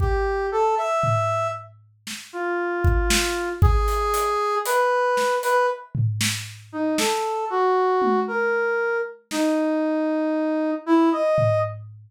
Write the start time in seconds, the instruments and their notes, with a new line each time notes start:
0.00 brass section G4, kick
0.52 brass section A4
0.78 brass section E5
1.03 floor tom
2.07 snare
2.33 brass section F4
2.84 kick
3.10 snare
3.62 brass section G#4, kick
3.88 closed hi-hat
4.14 closed hi-hat
4.66 brass section B4, closed hi-hat
5.17 snare
5.43 brass section B4, closed hi-hat
5.95 floor tom
6.21 snare
6.72 brass section D#4
6.98 brass section A4, snare
7.50 brass section F#4
8.02 high tom
8.28 brass section A#4
9.31 brass section D#4, snare
10.86 brass section E4
11.12 brass section D#5
11.38 floor tom